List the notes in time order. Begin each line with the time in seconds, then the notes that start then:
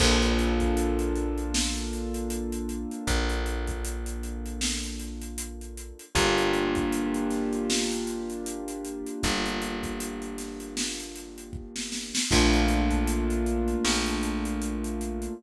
0.00 A#1 A#3 D4 F4 A4, kick, crash
0.22 closed hi-hat
0.39 closed hi-hat
0.60 kick, closed hi-hat
0.77 closed hi-hat
0.99 closed hi-hat
1.16 closed hi-hat
1.38 closed hi-hat
1.54 snare
1.75 closed hi-hat
1.93 closed hi-hat
2.14 closed hi-hat
2.30 closed hi-hat
2.52 closed hi-hat
2.69 closed hi-hat
2.91 closed hi-hat
3.07 A#1, kick, closed hi-hat
3.29 closed hi-hat
3.46 closed hi-hat
3.67 kick, closed hi-hat
3.85 closed hi-hat
4.06 closed hi-hat
4.23 closed hi-hat
4.46 closed hi-hat
4.61 snare
4.83 closed hi-hat
5.00 closed hi-hat
5.21 closed hi-hat
5.38 closed hi-hat
5.61 closed hi-hat
5.77 closed hi-hat
5.99 closed hi-hat
6.15 G1 A#3 D4 F4 G4, kick, closed hi-hat
6.38 closed hi-hat
6.54 closed hi-hat
6.75 kick, closed hi-hat
6.92 closed hi-hat
7.14 closed hi-hat
7.30 snare, closed hi-hat
7.53 closed hi-hat
7.70 snare
7.92 closed hi-hat
8.07 closed hi-hat
8.30 closed hi-hat
8.46 closed hi-hat
8.68 closed hi-hat
8.85 closed hi-hat
9.06 closed hi-hat
9.23 G1, kick, closed hi-hat
9.46 closed hi-hat
9.62 closed hi-hat
9.83 kick, closed hi-hat
10.00 closed hi-hat
10.22 closed hi-hat
10.38 snare, closed hi-hat
10.60 closed hi-hat
10.77 snare
11.00 closed hi-hat
11.16 closed hi-hat
11.38 closed hi-hat
11.53 kick
11.76 snare
11.92 snare
12.15 snare
12.31 A#1 A3 A#3 D4 F4, kick, crash
12.53 closed hi-hat
12.68 closed hi-hat
12.91 kick, closed hi-hat
13.07 closed hi-hat
13.30 closed hi-hat
13.46 closed hi-hat
13.68 closed hi-hat
13.85 A#1, snare
14.06 closed hi-hat
14.23 closed hi-hat
14.45 closed hi-hat
14.62 closed hi-hat
14.84 closed hi-hat
15.01 closed hi-hat
15.22 closed hi-hat